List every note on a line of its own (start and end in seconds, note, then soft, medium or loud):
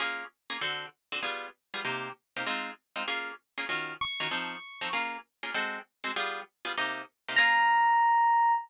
0.00 0.24 A#3 medium
0.00 0.24 C#4 medium
0.00 0.24 F4 medium
0.00 0.24 G#4 medium
0.50 0.57 A#3 medium
0.50 0.57 C#4 medium
0.50 0.57 F4 medium
0.50 0.57 G#4 medium
0.61 0.86 D3 medium
0.61 0.86 C4 medium
0.61 0.86 F#4 medium
0.61 0.86 A4 medium
1.12 1.20 D3 medium
1.12 1.20 C4 medium
1.12 1.20 F#4 medium
1.12 1.20 A4 medium
1.23 1.47 G3 medium
1.23 1.47 B3 medium
1.23 1.47 F4 medium
1.23 1.47 G#4 medium
1.74 1.81 G3 medium
1.74 1.81 B3 medium
1.74 1.81 F4 medium
1.74 1.81 G#4 medium
1.85 2.09 C3 medium
1.85 2.09 A#3 medium
1.85 2.09 D#4 medium
1.85 2.09 G4 medium
2.36 2.44 C3 medium
2.36 2.44 A#3 medium
2.36 2.44 D#4 medium
2.36 2.44 G4 medium
2.46 2.71 G#3 medium
2.46 2.71 C4 loud
2.46 2.71 D#4 medium
2.46 2.71 F4 medium
2.96 3.03 G#3 medium
2.96 3.03 C4 medium
2.96 3.03 D#4 medium
2.96 3.03 F4 medium
3.08 3.32 A#3 medium
3.08 3.32 C#4 medium
3.08 3.32 F4 medium
3.08 3.32 G#4 medium
3.58 3.65 A#3 medium
3.58 3.65 C#4 medium
3.58 3.65 F4 medium
3.58 3.65 G#4 medium
3.69 3.93 D#3 medium
3.69 3.93 C#4 medium
3.69 3.93 F4 medium
3.69 3.93 F#4 medium
4.01 4.89 C#6 medium
4.20 4.28 D#3 medium
4.20 4.28 C#4 medium
4.20 4.28 F4 medium
4.20 4.28 F#4 medium
4.31 4.56 F3 medium
4.31 4.56 C4 medium
4.31 4.56 D#4 medium
4.31 4.56 A4 medium
4.81 4.89 F3 medium
4.81 4.89 C4 medium
4.81 4.89 D#4 medium
4.81 4.89 A4 medium
4.93 5.17 A#3 medium
4.93 5.17 C#4 medium
4.93 5.17 F4 medium
4.93 5.17 G#4 medium
5.43 5.51 A#3 medium
5.43 5.51 C#4 medium
5.43 5.51 F4 medium
5.43 5.51 G#4 medium
5.54 5.79 G#3 medium
5.54 5.79 C4 medium
5.54 5.79 F#4 medium
5.54 5.79 A4 medium
6.04 6.11 G#3 medium
6.04 6.11 C4 medium
6.04 6.11 F#4 medium
6.04 6.11 A4 medium
6.16 6.41 G3 medium
6.16 6.41 B3 medium
6.16 6.41 F4 medium
6.16 6.41 G#4 medium
6.65 6.72 G3 medium
6.65 6.72 B3 medium
6.65 6.72 F4 medium
6.65 6.72 G#4 medium
6.77 7.02 C3 medium
6.77 7.02 A#3 medium
6.77 7.02 D#4 medium
6.77 7.02 G4 medium
7.29 7.36 C3 medium
7.29 7.36 A#3 medium
7.29 7.36 D#4 medium
7.29 7.36 G4 medium
7.36 8.54 A#3 loud
7.36 8.54 C#4 loud
7.36 8.54 F4 loud
7.36 8.54 G#4 medium
7.36 8.52 A#5 loud